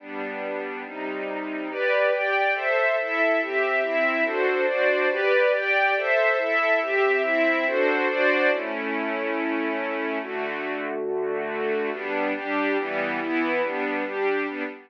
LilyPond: \new Staff { \time 6/8 \key g \major \tempo 4. = 141 <g b d'>2. | <c g ees'>2. | <g' b' d''>4. <g' d'' g''>4. | <a' c'' e''>4. <e' a' e''>4. |
<c' g' e''>4. <c' e' e''>4. | <d' fis' a' c''>4. <d' fis' c'' d''>4. | <g' b' d''>4. <g' d'' g''>4. | <a' c'' e''>4. <e' a' e''>4. |
<c' g' e''>4. <c' e' e''>4. | <d' fis' a' c''>4. <d' fis' c'' d''>4. | \key a \major <a cis' e'>2.~ | <a cis' e'>2. |
<d a fis'>2.~ | <d a fis'>2. | \key g \major <g b d'>4. <g d' g'>4. | <e g b>4. <e b e'>4. |
<g b d'>4. <g d' g'>4. | <g b d'>4. r4. | }